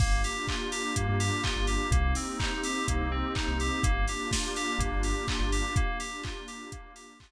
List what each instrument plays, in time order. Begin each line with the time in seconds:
0.00 synth bass 2 G1, electric piano 2 A#3, pad 5 (bowed) A#3 D4 F4 G4, kick, crash
0.24 electric piano 2 G4, open hi-hat
0.48 electric piano 2 F4, kick, clap
0.72 electric piano 2 G4, open hi-hat
0.96 synth bass 2 G2, electric piano 2 A#3, kick, closed hi-hat
1.09 synth bass 2 G2
1.20 electric piano 2 G4, open hi-hat
1.44 electric piano 2 F4, kick, clap
1.56 synth bass 2 G1
1.67 electric piano 2 G4, open hi-hat
1.91 synth bass 2 C2, electric piano 2 A#3, pad 5 (bowed) A#3 C4 D#4 G4, kick, closed hi-hat
2.15 electric piano 2 C4, open hi-hat
2.39 electric piano 2 D#4, kick, clap
2.64 electric piano 2 G4, open hi-hat
2.88 synth bass 2 C2, electric piano 2 A#3, kick, closed hi-hat
3.01 synth bass 2 C2
3.11 electric piano 2 C4
3.35 electric piano 2 D#4, kick, clap
3.48 synth bass 2 C2
3.60 electric piano 2 G4, open hi-hat
3.83 synth bass 2 G1, electric piano 2 A#3, pad 5 (bowed) A#3 D4 F4 G4, kick, closed hi-hat
4.08 electric piano 2 G4, open hi-hat
4.31 electric piano 2 F4, kick, snare
4.56 electric piano 2 G4, open hi-hat
4.78 synth bass 2 G1, electric piano 2 A#3, kick, closed hi-hat
4.92 synth bass 2 G1
5.03 electric piano 2 G4, open hi-hat
5.28 electric piano 2 F4, kick, clap
5.40 synth bass 2 G1
5.52 electric piano 2 G4, open hi-hat
5.76 pad 5 (bowed) A#3 D4 F4 G4, electric piano 2 A#3, kick, closed hi-hat
6.00 electric piano 2 G4, open hi-hat
6.24 electric piano 2 F4, kick, clap
6.48 electric piano 2 G4, open hi-hat
6.72 electric piano 2 A#3, kick, closed hi-hat
6.96 electric piano 2 G4, open hi-hat
7.20 electric piano 2 F4, kick, clap